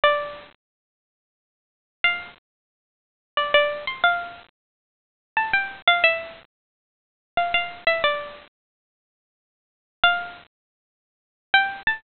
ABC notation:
X:1
M:3/4
L:1/16
Q:1/4=90
K:F
V:1 name="Pizzicato Strings"
d6 z6 | f8 d d2 c' | f8 a g2 f | e8 f f2 e |
d6 z6 | f8 z g2 a |]